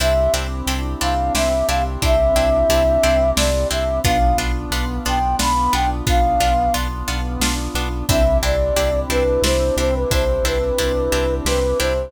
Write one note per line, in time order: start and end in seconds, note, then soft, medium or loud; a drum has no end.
0.00 0.28 C2 loud
0.00 0.13 C4 medium
0.00 4.00 C4 medium
0.00 0.13 D4 medium
0.00 4.00 D4 medium
0.00 0.13 E4 medium
0.00 4.00 E4 medium
0.00 0.13 G4 medium
0.00 4.00 G4 medium
0.00 0.33 E5 medium
0.00 closed hi-hat medium
0.33 0.62 C2 medium
0.33 0.47 C4 medium
0.33 0.47 D4 medium
0.33 0.47 E4 medium
0.33 0.47 G4 medium
0.33 closed hi-hat medium
0.66 0.95 C2 loud
0.66 0.81 C4 medium
0.66 0.81 D4 medium
0.66 0.81 E4 medium
0.66 0.81 G4 medium
0.66 closed hi-hat medium
1.01 1.30 C2 loud
1.01 1.14 C4 medium
1.01 1.14 D4 medium
1.01 1.14 E4 medium
1.01 1.14 G4 medium
1.01 1.33 F5 medium
1.01 closed hi-hat medium
1.34 1.63 C2 medium
1.34 1.49 C4 medium
1.34 1.49 D4 medium
1.34 1.49 E4 medium
1.34 1.49 G4 medium
1.34 1.67 E5 medium
1.34 snare medium
1.68 1.97 C2 loud
1.68 1.82 C4 medium
1.68 1.82 D4 medium
1.68 1.82 E4 medium
1.68 1.82 G4 medium
1.68 1.84 F5 medium
1.68 closed hi-hat medium
2.02 2.32 C2 medium
2.02 2.16 C4 medium
2.02 2.16 D4 medium
2.02 2.16 E4 medium
2.02 2.16 G4 medium
2.02 3.31 E5 loud
2.02 kick medium
2.02 closed hi-hat medium
2.35 2.64 C2 medium
2.35 2.49 C4 medium
2.35 2.49 D4 medium
2.35 2.49 E4 medium
2.35 2.49 G4 medium
2.35 closed hi-hat medium
2.69 2.98 C2 loud
2.69 2.83 C4 medium
2.69 2.83 D4 medium
2.69 2.83 E4 medium
2.69 2.83 G4 medium
2.69 closed hi-hat loud
3.03 3.32 C2 loud
3.03 3.17 C4 medium
3.03 3.17 D4 medium
3.03 3.17 E4 medium
3.03 3.17 G4 medium
3.03 closed hi-hat medium
3.37 3.65 C2 loud
3.37 3.51 C4 medium
3.37 3.51 D4 medium
3.37 3.51 E4 medium
3.37 3.51 G4 medium
3.37 3.68 D5 medium
3.37 snare loud
3.71 4.00 C2 medium
3.71 3.84 C4 medium
3.71 3.84 D4 medium
3.71 3.84 E4 medium
3.71 3.84 G4 medium
3.71 4.00 E5 medium
3.71 closed hi-hat medium
4.04 4.34 B1 loud
4.04 4.18 B3 loud
4.04 8.05 B3 medium
4.04 4.18 D4 medium
4.04 8.05 D4 medium
4.04 4.18 F4 medium
4.04 8.05 F4 medium
4.04 4.37 F5 medium
4.04 kick medium
4.04 closed hi-hat medium
4.37 4.66 B1 loud
4.37 4.52 B3 medium
4.37 4.52 D4 medium
4.37 4.52 F4 medium
4.37 closed hi-hat medium
4.70 4.99 B1 loud
4.70 4.85 B3 medium
4.70 4.85 D4 medium
4.70 4.85 F4 medium
4.70 closed hi-hat medium
5.05 5.35 B1 medium
5.05 5.19 B3 medium
5.05 5.19 D4 medium
5.05 5.19 F4 medium
5.05 5.36 G5 medium
5.05 closed hi-hat medium
5.39 5.68 B1 medium
5.39 5.53 B3 medium
5.39 5.53 D4 medium
5.39 5.53 F4 medium
5.39 5.74 B5 medium
5.39 snare loud
5.73 6.02 B1 loud
5.73 5.86 B3 medium
5.73 5.86 D4 medium
5.73 5.86 F4 medium
5.73 5.89 G5 medium
5.73 closed hi-hat medium
6.07 6.36 B1 medium
6.07 6.20 B3 medium
6.07 6.20 D4 medium
6.07 6.20 F4 medium
6.07 6.73 F5 medium
6.07 kick medium
6.07 closed hi-hat medium
6.40 6.69 B1 loud
6.40 6.54 B3 medium
6.40 6.54 D4 medium
6.40 6.54 F4 medium
6.40 closed hi-hat medium
6.74 7.03 B1 medium
6.74 6.88 B3 medium
6.74 6.88 D4 medium
6.74 6.88 F4 medium
6.74 closed hi-hat medium
7.08 7.37 B1 loud
7.08 7.21 B3 medium
7.08 7.21 D4 medium
7.08 7.21 F4 medium
7.08 closed hi-hat medium
7.40 7.68 B1 medium
7.40 7.55 B3 medium
7.40 7.55 D4 medium
7.40 7.55 F4 medium
7.40 snare loud
7.74 8.03 B1 loud
7.74 7.89 B3 medium
7.74 7.89 D4 medium
7.74 7.89 F4 medium
7.74 closed hi-hat medium
8.09 8.39 C2 loud
8.09 12.10 C4 medium
8.09 8.23 C4 medium
8.09 12.10 D4 medium
8.09 8.23 D4 medium
8.09 12.10 E4 medium
8.09 8.23 E4 medium
8.09 12.10 G4 medium
8.09 8.23 G4 medium
8.09 8.37 E5 medium
8.09 kick loud
8.09 closed hi-hat loud
8.43 8.71 C2 loud
8.43 8.56 C4 medium
8.43 8.56 D4 medium
8.43 8.56 E4 medium
8.43 8.56 G4 medium
8.43 9.00 D5 medium
8.43 closed hi-hat medium
8.76 9.05 C2 loud
8.76 8.90 C4 medium
8.76 8.90 D4 medium
8.76 8.90 E4 medium
8.76 8.90 G4 medium
8.76 closed hi-hat medium
9.09 9.38 C2 medium
9.09 9.23 C4 medium
9.09 9.23 D4 medium
9.09 9.23 E4 medium
9.09 9.23 G4 medium
9.09 9.42 B4 medium
9.09 closed hi-hat medium
9.42 9.71 C2 loud
9.42 9.57 C4 medium
9.42 9.57 D4 medium
9.42 9.57 E4 medium
9.42 9.57 G4 medium
9.42 9.76 C5 medium
9.42 snare medium
9.76 10.05 C2 loud
9.76 9.91 C4 medium
9.76 9.91 D4 medium
9.76 9.91 E4 medium
9.76 9.91 G4 medium
9.76 9.95 C5 medium
9.76 closed hi-hat medium
9.95 10.11 B4 medium
10.10 10.39 C2 medium
10.10 10.25 C4 medium
10.10 10.25 D4 medium
10.10 10.25 E4 medium
10.10 10.25 G4 medium
10.10 10.45 C5 medium
10.10 kick medium
10.10 closed hi-hat medium
10.43 10.72 C2 medium
10.43 10.58 C4 medium
10.43 10.58 D4 medium
10.43 10.58 E4 medium
10.43 10.58 G4 medium
10.43 11.35 B4 medium
10.43 closed hi-hat medium
10.78 11.08 C2 medium
10.78 10.92 C4 medium
10.78 10.92 D4 medium
10.78 10.92 E4 medium
10.78 10.92 G4 medium
10.78 closed hi-hat medium
11.12 11.41 C2 loud
11.12 11.26 C4 medium
11.12 11.26 D4 medium
11.12 11.26 E4 medium
11.12 11.26 G4 medium
11.12 closed hi-hat medium
11.45 11.74 C2 loud
11.45 11.60 C4 medium
11.45 11.60 D4 medium
11.45 11.60 E4 medium
11.45 11.60 G4 medium
11.45 11.79 B4 medium
11.45 snare medium
11.79 12.09 C2 medium
11.79 11.93 C4 medium
11.79 11.93 D4 medium
11.79 11.93 E4 medium
11.79 11.93 G4 medium
11.79 12.11 C5 medium
11.79 closed hi-hat medium